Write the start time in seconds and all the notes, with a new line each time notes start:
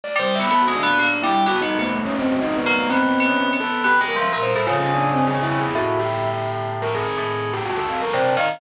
0.04 D5
0.16 G3 C5
0.35 B3 E5
0.51 B3 A4
0.62 F#4
0.68 G#3
0.76 D4
0.83 B3
0.98 A#3
1.22 G3 E4
1.46 B3 F#4
1.61 B3 D#4
1.78 A3 B3
1.94 A3
2.05 C#4
2.18 C4
2.31 F#4
2.42 D#4
2.57 B3
2.66 A#3
2.75 A3
2.89 B3 C4
3.20 B3
3.26 C#4
3.53 B3
3.60 A4
3.84 B3 G4
4.01 G#3
4.08 A#4
4.16 F3
4.21 E5
4.33 A#2
4.43 C5
4.55 A2
4.67 C#3 F4
4.78 C#4
4.94 D4
5.13 C4
5.27 G#4
5.42 E4
5.60 G#4
5.75 A2 F#4
5.99 G4
6.82 A#4
6.95 G#4
7.18 A2
7.53 G4
7.66 F#4
7.77 A4
7.90 F5
8.02 A#4
8.13 C3 D5
8.24 A5
8.37 D#3 F5